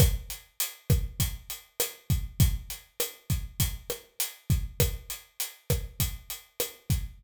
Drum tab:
HH |xxxxxxxx|xxxxxxxx|xxxxxxxx|
SD |r--r--r-|--r--r--|r--r--r-|
BD |o--oo--o|o--oo--o|o--oo--o|